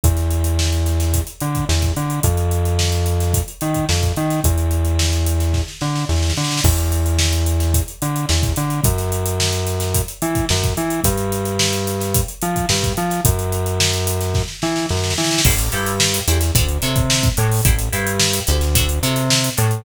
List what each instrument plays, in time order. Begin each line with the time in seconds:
0.04 synth bass 1 E2, kick, closed hi-hat
0.17 snare, closed hi-hat
0.31 closed hi-hat
0.44 closed hi-hat
0.59 snare
0.73 closed hi-hat
0.86 snare, closed hi-hat
1.00 snare, closed hi-hat
1.14 kick, closed hi-hat
1.27 closed hi-hat
1.40 synth bass 1 D3, closed hi-hat
1.55 kick, closed hi-hat
1.69 synth bass 1 E2, snare
1.82 kick, snare, closed hi-hat
1.97 synth bass 1 D3, closed hi-hat
2.10 closed hi-hat
2.23 synth bass 1 F2, kick, closed hi-hat
2.37 closed hi-hat
2.51 closed hi-hat
2.65 closed hi-hat
2.79 snare
2.92 closed hi-hat
3.06 snare, closed hi-hat
3.20 snare, closed hi-hat
3.33 kick, closed hi-hat
3.48 closed hi-hat
3.61 synth bass 1 D#3, closed hi-hat
3.74 kick, closed hi-hat
3.89 synth bass 1 F2, snare
4.02 kick, closed hi-hat
4.17 synth bass 1 D#3, closed hi-hat
4.30 snare, closed hi-hat
4.44 synth bass 1 E2, kick, closed hi-hat
4.58 closed hi-hat
4.71 closed hi-hat
4.85 closed hi-hat
4.99 snare
5.13 closed hi-hat
5.26 closed hi-hat
5.40 snare, closed hi-hat
5.54 kick, snare
5.68 snare
5.81 synth bass 1 D3, snare
5.96 snare
6.09 synth bass 1 E2, snare
6.16 snare
6.22 snare
6.30 snare
6.37 synth bass 1 D3, snare
6.44 snare
6.51 snare
6.57 snare
6.64 synth bass 1 E2, kick, crash
6.78 closed hi-hat
6.92 closed hi-hat
7.06 closed hi-hat
7.19 snare
7.33 closed hi-hat
7.46 closed hi-hat
7.60 snare, closed hi-hat
7.74 kick, closed hi-hat
7.88 closed hi-hat
8.02 synth bass 1 D3, closed hi-hat
8.16 closed hi-hat
8.29 synth bass 1 E2, snare
8.43 kick, closed hi-hat
8.56 synth bass 1 D3, snare, closed hi-hat
8.70 closed hi-hat
8.84 synth bass 1 F#2, kick, closed hi-hat
8.98 snare, closed hi-hat
9.12 closed hi-hat
9.26 closed hi-hat
9.40 snare
9.53 closed hi-hat
9.67 snare, closed hi-hat
9.80 snare, closed hi-hat
9.94 kick, closed hi-hat
10.08 closed hi-hat
10.22 synth bass 1 E3, closed hi-hat
10.35 kick, closed hi-hat
10.49 synth bass 1 F#2, snare
10.63 kick, snare, closed hi-hat
10.77 synth bass 1 E3, closed hi-hat
10.90 closed hi-hat
11.04 synth bass 1 G2, kick, closed hi-hat
11.18 closed hi-hat
11.32 closed hi-hat
11.45 closed hi-hat
11.59 snare
11.73 closed hi-hat
11.87 snare, closed hi-hat
12.00 snare, closed hi-hat
12.14 kick, closed hi-hat
12.28 closed hi-hat
12.42 synth bass 1 F3, closed hi-hat
12.56 kick, closed hi-hat
12.69 synth bass 1 G2, snare
12.83 kick, closed hi-hat
12.97 synth bass 1 F3, closed hi-hat
13.10 snare, closed hi-hat
13.25 synth bass 1 F#2, kick, closed hi-hat
13.39 closed hi-hat
13.52 closed hi-hat
13.66 closed hi-hat
13.80 snare
13.94 closed hi-hat
14.07 closed hi-hat
14.21 snare, closed hi-hat
14.34 kick, snare
14.48 snare
14.62 synth bass 1 E3, snare
14.76 snare
14.89 synth bass 1 F#2, snare
14.97 snare
15.04 snare
15.10 snare
15.18 synth bass 1 E3, snare
15.24 snare
15.31 snare
15.38 snare
15.44 synth bass 1 A1, acoustic guitar (steel) E4 G4 A4 C5, kick, crash
15.58 closed hi-hat
15.72 synth bass 1 G2, acoustic guitar (steel) E4 G4 A4 C5, snare, closed hi-hat
15.86 closed hi-hat
16.00 snare
16.14 closed hi-hat
16.28 synth bass 1 E2, acoustic guitar (steel) E4 G4 A4 C5, closed hi-hat
16.41 snare, closed hi-hat
16.55 synth bass 1 D2, acoustic guitar (steel) D4 F#4 A4 C#5, kick, closed hi-hat
16.69 closed hi-hat
16.82 synth bass 1 C3, acoustic guitar (steel) D4 F#4 A4 C#5, closed hi-hat
16.96 kick, closed hi-hat
17.10 snare
17.23 kick, closed hi-hat
17.37 synth bass 1 A2, acoustic guitar (steel) D4 F#4 A4 C#5, closed hi-hat
17.52 open hi-hat
17.65 synth bass 1 A1, acoustic guitar (steel) E4 G4 A4 C5, kick, closed hi-hat
17.79 closed hi-hat
17.93 synth bass 1 G2, acoustic guitar (steel) E4 G4 A4 C5, closed hi-hat
18.07 closed hi-hat
18.19 snare
18.33 closed hi-hat
18.47 synth bass 1 D2, acoustic guitar (steel) E4 G4 A4 C5, snare, closed hi-hat
18.61 snare, closed hi-hat
18.75 acoustic guitar (steel) D4 F#4 A4 C#5, kick, closed hi-hat
18.89 closed hi-hat
19.03 synth bass 1 C3, acoustic guitar (steel) D4 F#4 A4 C#5, closed hi-hat
19.16 snare, closed hi-hat
19.31 snare
19.44 closed hi-hat
19.57 synth bass 1 A2, acoustic guitar (steel) D4 F#4 A4 C#5, closed hi-hat
19.71 closed hi-hat